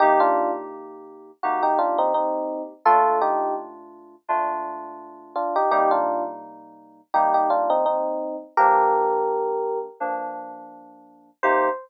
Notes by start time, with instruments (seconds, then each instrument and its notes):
0.00 electric piano 2 C3 A#3 D#4 G4, electric piano 1 D#4 G4
0.20 electric piano 1 D4 F4
1.43 electric piano 2 C3 A#3 D#4 G4, electric piano 1 F#4
1.63 electric piano 1 D#4 G4
1.79 electric piano 1 D4 F4
1.98 electric piano 1 C4 D#4
2.14 electric piano 1 C4 D#4
2.85 electric piano 2 A#2 A3 D4 F4, electric piano 1 F4 A4
3.21 electric piano 1 D#4 G4
4.28 electric piano 2 A#2 A3 D4 F4
5.36 electric piano 1 D4 F4
5.56 electric piano 1 D#4 G4
5.71 electric piano 2 C3 G3 A#3 D#4, electric piano 1 D#4 G4
5.91 electric piano 1 D4 F4
7.14 electric piano 2 C3 G3 A#3 D#4, electric piano 1 D#4 G4
7.34 electric piano 1 D#4 G4
7.50 electric piano 1 D4 F4
7.70 electric piano 1 C4 D#4
7.86 electric piano 1 C4 D#4
8.57 electric piano 2 G2 F3 A#3 D4, electric piano 1 G4 A#4
10.00 electric piano 2 G2 F3 A#3 D4
11.43 electric piano 2 C3 A#3 D#4 G4, electric piano 1 C5